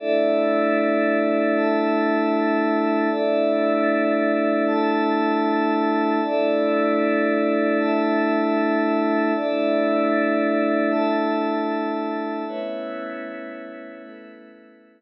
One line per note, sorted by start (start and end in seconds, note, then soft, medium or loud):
0.00 3.09 A3 medium
0.00 3.09 D4 medium
0.00 3.09 E4 medium
0.00 1.54 A4 loud
0.00 1.54 D5 loud
0.00 1.54 E5 loud
1.56 3.10 A4 loud
1.56 3.10 E5 loud
1.56 3.10 A5 medium
3.11 6.20 A3 medium
3.11 6.20 D4 medium
3.11 6.20 E4 medium
3.11 4.65 A4 medium
3.11 4.65 D5 loud
3.11 4.65 E5 loud
4.67 6.21 A4 loud
4.67 6.21 E5 medium
4.67 6.21 A5 loud
6.23 9.32 A3 medium
6.23 9.32 D4 medium
6.23 9.32 E4 medium
6.23 7.78 A4 loud
6.23 7.78 D5 loud
6.23 7.78 E5 loud
7.79 9.33 A4 loud
7.79 9.33 E5 loud
7.79 9.33 A5 medium
9.35 12.44 A3 medium
9.35 12.44 D4 medium
9.35 12.44 E4 medium
9.35 10.90 A4 medium
9.35 10.90 D5 loud
9.35 10.90 E5 loud
10.91 12.45 A4 loud
10.91 12.45 E5 medium
10.91 12.45 A5 loud
12.47 15.01 A3 medium
12.47 14.02 A3 loud
12.47 15.01 B3 medium
12.47 15.01 C#4 medium
12.47 15.01 E4 medium
12.47 14.02 B4 medium
12.47 14.02 C#5 loud
12.47 14.02 E5 loud
14.03 15.01 A3 loud
14.03 15.01 A4 medium
14.03 15.01 B4 loud
14.03 15.01 E5 loud